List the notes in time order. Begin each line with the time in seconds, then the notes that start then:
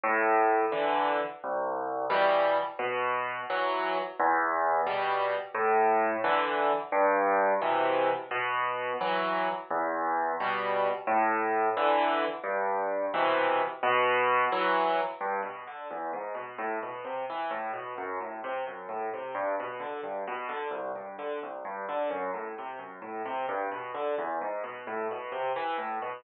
0.03 A2
0.72 D3 E3
1.44 C2
2.10 B2 E3 G3
2.79 B2
3.50 E3 F#3
4.19 E2
4.86 B2 G3
5.54 A2
6.24 D3 E3
6.92 G2
7.61 B2 C3 E3
8.31 B2
9.01 E3 F#3
9.70 E2
10.40 B2 G3
11.07 A2
11.77 D3 E3
12.44 G2
13.14 B2 C3 E3
13.83 B2
14.52 E3 F#3
15.21 G2
15.43 B2
15.67 D3
15.91 E2
16.13 G#2
16.34 B2
16.58 A2
16.83 B2
17.05 C3
17.30 E3
17.51 A2
17.73 B2
17.98 F#2
18.20 A2
18.44 C3
18.67 F#2
18.89 A2
19.14 C3
19.35 G2
19.60 B2
19.80 D3
20.03 G2
20.27 B2
20.49 D3
20.71 C2
20.95 G2
21.18 D3
21.43 C2
21.65 G2
21.89 D3
22.10 F#2
22.34 A2
22.58 C3
22.79 F#2
23.02 A2
23.25 C3
23.49 G2
23.71 B2
23.94 D3
24.18 E2
24.41 G#2
24.64 B2
24.87 A2
25.11 B2
25.32 C3
25.56 E3
25.78 A2
26.02 B2